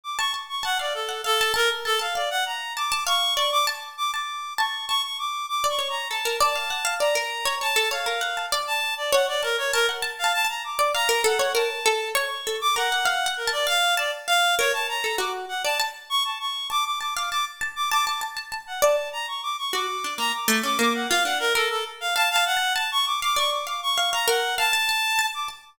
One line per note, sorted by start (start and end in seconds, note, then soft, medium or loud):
0.04 0.17 D6 medium
0.19 0.32 A5 medium
0.19 0.32 C#6 medium
0.34 0.48 A5 medium
0.49 0.63 C#6 medium
0.63 0.78 F#5 medium
0.63 0.77 A5 medium
0.79 0.93 D5 medium
0.79 1.07 F5 medium
0.94 1.21 A4 medium
1.09 1.22 F#5 medium
1.24 1.52 A4 loud
1.24 1.38 F5 medium
1.41 1.53 A5 loud
1.54 1.69 A#4 loud
1.54 1.81 A5 loud
1.85 1.99 A4 loud
1.85 1.99 A5 medium
1.99 2.14 F5 medium
1.99 2.13 A5 medium
2.15 2.29 D5 medium
2.15 2.70 F5 medium
2.31 2.44 F#5 medium
2.46 2.73 A#5 medium
2.77 2.90 A5 medium
2.77 3.04 D6 medium
2.92 3.05 A5 loud
3.07 3.34 F5 loud
3.07 3.34 C#6 loud
3.37 3.64 D5 medium
3.37 3.51 C#6 medium
3.52 3.66 D6 loud
3.67 3.94 A5 medium
3.97 4.11 D6 medium
4.13 4.41 A5 medium
4.13 4.53 D6 medium
4.58 4.86 A5 medium
4.58 4.85 C#6 medium
4.88 5.57 A5 medium
4.88 5.02 C#6 loud
5.03 5.17 C#6 medium
5.19 5.46 D6 medium
5.49 5.67 D6 medium
5.64 5.78 D5 medium
5.69 5.88 C#6 medium
5.79 6.06 C#5 medium
5.90 6.08 A#5 medium
6.10 6.24 A4 medium
6.10 6.37 A5 medium
6.25 6.39 A#4 medium
6.40 6.54 D5 loud
6.40 6.95 A5 medium
6.56 6.69 F5 medium
6.70 6.84 F#5 medium
6.85 6.98 F5 loud
7.00 7.14 D5 medium
7.00 7.55 A#5 medium
7.15 7.43 A#4 medium
7.45 7.59 C#5 loud
7.61 7.75 C#5 medium
7.61 7.89 A5 medium
7.76 7.90 A4 loud
7.91 8.05 C#5 medium
7.91 8.46 F5 medium
8.06 8.20 A#4 medium
8.21 8.35 F#5 medium
8.37 8.51 A5 medium
8.52 8.80 D5 loud
8.67 8.94 A5 medium
8.97 9.11 D5 medium
9.13 9.26 C#5 loud
9.13 9.26 F#5 medium
9.28 9.42 D5 medium
9.43 9.56 A#4 medium
9.43 9.56 A5 medium
9.58 9.71 C#5 medium
9.73 9.87 A#4 loud
9.73 9.87 A5 loud
9.89 10.03 F#5 medium
10.02 10.21 A5 loud
10.19 10.32 F5 medium
10.24 10.42 A5 medium
10.34 10.47 A5 loud
10.45 10.63 A5 medium
10.49 10.63 A#5 medium
10.64 10.91 D6 medium
10.79 10.93 D5 loud
10.94 11.08 F5 medium
10.94 11.22 A#5 loud
11.09 11.23 A#4 loud
11.24 11.38 A4 loud
11.24 11.52 F#5 medium
11.39 11.53 C#5 loud
11.55 11.68 A#4 medium
11.55 12.09 A5 medium
11.86 12.13 A4 loud
12.15 12.29 C#5 loud
12.15 12.57 C#6 medium
12.47 12.60 A4 medium
12.61 12.75 D6 loud
12.76 12.90 A#4 medium
12.76 13.31 F#5 medium
12.92 13.06 F#5 medium
13.05 13.24 F5 loud
13.26 13.44 F#5 loud
13.37 13.51 A#4 medium
13.47 13.66 A5 loud
13.52 13.66 D5 medium
13.67 13.94 F5 medium
13.67 13.95 F5 loud
13.97 14.11 D5 medium
13.97 14.25 A5 loud
14.28 14.55 F5 loud
14.28 14.55 F5 medium
14.58 14.72 A#4 loud
14.58 14.72 C#5 loud
14.73 14.87 A5 medium
14.89 15.16 A#5 medium
15.04 15.18 A4 medium
15.18 15.46 F#4 medium
15.18 15.32 D6 medium
15.49 15.62 F#5 medium
15.64 15.78 D5 medium
15.64 15.78 A5 medium
15.80 16.34 A5 loud
16.10 16.23 C#6 loud
16.25 16.38 A5 soft
16.40 16.67 C#6 medium
16.70 16.97 A5 medium
16.70 16.84 D6 loud
16.85 16.99 D6 medium
17.01 17.14 A5 medium
17.01 17.14 D6 medium
17.16 17.30 F5 medium
17.16 17.29 D6 medium
17.31 17.59 A5 medium
17.31 17.45 D6 medium
17.61 17.75 A5 medium
17.76 17.90 D6 medium
17.91 18.05 A5 loud
17.91 18.05 D6 loud
18.07 18.21 A5 medium
18.07 18.20 D6 medium
18.21 18.35 A5 medium
18.37 18.50 A5 medium
18.52 18.66 A5 medium
18.67 18.81 F#5 soft
18.82 18.96 D5 loud
18.82 19.09 A5 medium
19.13 19.26 A#5 medium
19.28 19.41 C#6 medium
19.43 19.56 D6 medium
19.58 19.72 C#6 medium
19.73 19.87 F#4 medium
19.73 20.14 D6 medium
20.04 20.18 D4 medium
20.18 20.32 A#3 medium
20.18 20.32 A#5 loud
20.34 20.61 D6 medium
20.48 20.62 A3 loud
20.63 20.77 C#4 medium
20.63 20.78 D6 medium
20.79 21.06 A#3 medium
20.79 20.93 D6 medium
20.94 21.08 F#5 medium
21.09 21.24 F4 loud
21.09 21.23 F5 loud
21.25 21.52 D4 medium
21.25 21.38 F#5 medium
21.40 21.53 A#4 loud
21.55 21.69 A4 medium
21.55 22.10 A#4 loud
21.70 21.84 A4 medium
22.01 22.14 F5 medium
22.16 22.34 F5 loud
22.16 22.29 A5 loud
22.31 22.44 F5 loud
22.36 22.54 A5 loud
22.46 22.73 F#5 loud
22.57 22.75 A5 medium
22.76 23.17 A5 medium
22.76 22.90 A5 medium
22.92 23.05 C#6 loud
23.06 23.20 D6 medium
23.22 23.36 F5 medium
23.22 23.36 D6 loud
23.36 23.64 D5 medium
23.36 23.50 C#6 medium
23.52 23.66 D6 medium
23.67 23.94 F5 medium
23.67 23.81 D6 medium
23.83 24.10 C#6 medium
23.98 24.11 F5 medium
24.13 24.27 F5 medium
24.13 24.26 A#5 medium
24.28 24.55 A#4 loud
24.28 24.55 F#5 medium
24.58 24.72 F5 loud
24.58 25.26 A5 loud
24.73 24.87 A5 loud
24.89 25.16 A5 loud
25.19 25.32 A5 medium
25.34 25.48 D6 medium
25.48 25.76 A5 medium